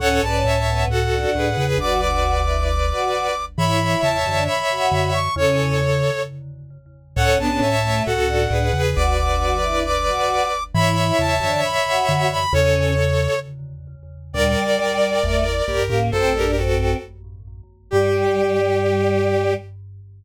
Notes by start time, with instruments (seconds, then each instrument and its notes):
0.00 vibraphone C#2 A2, choir aahs C#4, violin A4 C#5, brass section F#5
0.22 vibraphone B1 G#2, choir aahs C#4, violin B4 D5, brass section A5
0.44 vibraphone C#2 A2, violin C#5 E5
0.67 choir aahs B3
0.87 vibraphone C#2 A2, violin F#4 A4, brass section F#5
1.12 choir aahs D4
1.34 vibraphone C#2 A2, violin G#4 B4
1.57 vibraphone E2 C#3, violin G#4 B4
1.78 vibraphone F#1 D2, choir aahs F#4, violin B4 D5, brass section D6
2.01 choir aahs F#4, brass section D6
2.46 choir aahs E4
2.67 brass section D6
2.91 choir aahs F#4
3.57 vibraphone G#2 E3, choir aahs E4, violin C#5 E5, brass section B5
3.81 choir aahs E4
4.03 vibraphone E2 C#3, brass section A5
4.26 vibraphone F#2 D3, choir aahs D4
4.48 brass section B5
4.71 choir aahs F#4
4.92 vibraphone F#2 D3
5.14 brass section C#6
5.36 vibraphone E2 C#3, choir aahs C#4, violin A4 C#5, brass section C#5
7.16 vibraphone C#2 A2, choir aahs C#4, violin A4 C#5, brass section F#5
7.38 vibraphone B1 G#2, violin B3 D4, choir aahs C#4, brass section A5
7.61 vibraphone C#2 A2, violin C#5 E5
7.83 choir aahs A3
8.06 vibraphone C#2 A2, violin F#4 A4, brass section F#5
8.28 choir aahs D4
8.51 vibraphone C#2 A2, violin G#4 B4
8.73 vibraphone E2 C#3, violin G#4 B4
8.95 vibraphone F#1 D2, choir aahs F#4, violin B4 D5, brass section D6
9.18 choir aahs F#4, brass section D6
9.62 choir aahs E4
9.85 brass section D6
10.07 choir aahs F#4
10.74 vibraphone G#2 E3, choir aahs E4, violin C#5 E5, brass section B5
10.97 choir aahs E4
11.18 vibraphone E2 C#3, brass section A5
11.40 vibraphone F#2 D3, choir aahs D4
11.64 brass section B5
11.87 choir aahs F#4
12.09 vibraphone F#2 D3
12.32 brass section B5
12.53 vibraphone E2 C#3, choir aahs C#4, violin A4 C#5, brass section C#5
14.33 vibraphone D2 A#2, choir aahs G3, violin A#4 D5, brass section D5
15.23 vibraphone G1 E2, choir aahs A3
15.67 vibraphone A#1 G2, violin G4 A#4
15.89 vibraphone C#2 A2, choir aahs A#3
16.12 vibraphone A1 F#2, choir aahs C4, brass section A4, violin A4 C5
16.34 choir aahs D4, violin G4 A#4
16.57 choir aahs C4, violin F#4 A4
17.91 vibraphone G2, choir aahs G3, brass section G4, violin G4